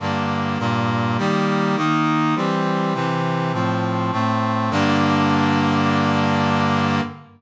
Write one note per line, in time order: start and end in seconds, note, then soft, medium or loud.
0.00 0.58 G2 medium
0.00 0.58 D3 medium
0.00 0.58 A#3 medium
0.59 1.17 G2 medium
0.59 1.17 A#2 medium
0.59 1.17 A#3 medium
1.18 1.76 D#3 medium
1.18 1.76 G3 loud
1.18 1.76 A#3 medium
1.76 2.35 D#3 medium
1.76 2.35 A#3 medium
1.76 2.35 D#4 medium
2.35 2.93 E3 medium
2.35 2.94 G3 medium
2.35 2.93 C4 medium
2.94 3.52 C3 medium
2.94 3.52 E3 medium
2.94 3.52 C4 medium
3.53 4.11 A2 medium
3.53 4.11 F3 medium
3.53 4.11 C4 medium
4.12 4.70 A2 medium
4.12 4.70 A3 medium
4.12 4.70 C4 medium
4.70 7.01 G2 loud
4.70 7.01 D3 loud
4.70 7.01 A#3 loud